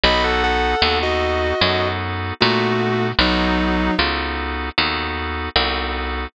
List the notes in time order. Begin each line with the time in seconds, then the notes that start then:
0.03 B1 B3 D#4 F#4 A4 D#5 B5
0.24 A4 F#5
0.43 A4 F#5
0.82 D#2 B3 D#4 F#4 A4
1.02 F#4 D#5
1.61 F#2 B3 D#4 F#4 A4
2.40 A#2 A3 B3 D#4 F#4 A4
3.19 B1 F#3 B3 D#4 F#4 A4
3.98 C#2 B3 D#4 F#4 A4
4.78 D#2 B3 D#4 F#4 A4
5.56 C2 B3 D#4 F#4 A4